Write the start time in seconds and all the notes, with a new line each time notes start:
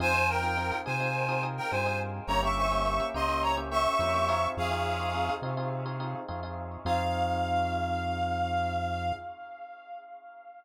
0.00 F2 C4 D#4 F4 G#4 C5 G#5
0.14 C4 D#4 F4 G#4
0.29 A#4 G5
0.43 C4 D#4 F4 G#4
0.57 C4 D#4 F4 G#4
0.72 C4 D#4 F4 G#4
0.86 C3 C4 D#4 F4 G#4 C5 G#5
1.00 C4 D#4 F4 G#4
1.29 C4 D#4 F4 G#4
1.43 C4 D#4 F4 G#4
1.57 A#4 G5
1.71 G2 C4 D#4 F4 G#4 C5 G#5
1.86 C4 D#4 F4 G#4
2.27 G1 A#3 C#4 E4 G4 C#5 A#5
2.43 A#3 C#4 E4 G4 E5 C#6
2.57 E5 C#6
2.72 A#3 C#4 E4 G4
2.86 A#3 C#4 E4 G4
3.00 A#3 C#4 E4 G4
3.14 C#2 A#3 C#4 E4 G4 D#5 C6
3.29 A#3 C#4 E4 G4
3.42 C#5 A#5
3.57 A#3 C#4 E4 G4
3.71 A#3 C#4 E4 G4 E5 C#6
3.99 F2 A#3 C#4 E4 G4
4.14 A#3 C#4 E4 G4
4.29 C4 D#4 F4 G#4
4.57 F2 G#4 F5
4.71 C4 D#4 F4 G#4
5.00 C4 D#4 F4 G#4
5.14 C4 D#4 F4 G#4
5.29 C4 D#4 F4 G#4
5.42 C3 C4 D#4 F4 G#4
5.57 C4 D#4 F4 G#4
5.86 C4 D#4 F4 G#4
6.00 C4 D#4 F4 G#4
6.28 F2 C4 D#4 F4 G#4
6.43 C4 D#4 F4 G#4
6.85 F2 C4 D#4 F4 G#4 F5